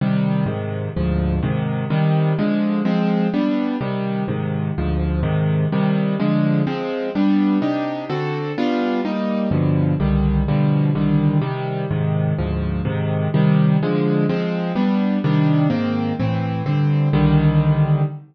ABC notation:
X:1
M:6/8
L:1/8
Q:3/8=126
K:Cm
V:1 name="Acoustic Grand Piano"
[C,E,G,]3 [A,,C,E,]3 | [D,,A,,F,]3 [A,,C,E,]3 | [C,E,G,]3 [D,F,A,]3 | [F,A,C]3 [G,=B,D]3 |
[C,E,G,]3 [A,,C,E,]3 | [D,,A,,F,]3 [A,,C,E,]3 | [C,E,G,]3 [D,F,A,]3 | [F,A,C]3 [G,=B,D]3 |
[C,DEG]3 [D,C^F=A]3 | [G,=B,DF]3 [G,_B,E]3 | [G,,=B,,D,F,]3 [C,,D,E,G,]3 | [=B,,D,F,G,]3 [C,,D,E,G,]3 |
[C,E,G,]3 [A,,C,E,]3 | [D,,A,,F,]3 [A,,C,E,]3 | [C,E,G,]3 [D,F,A,]3 | [F,A,C]3 [G,=B,D]3 |
[C,E,G,D]3 [A,,E,B,C]3 | [=A,,=E,C]3 [G,,D,C]3 | [C,,D,E,G,]6 |]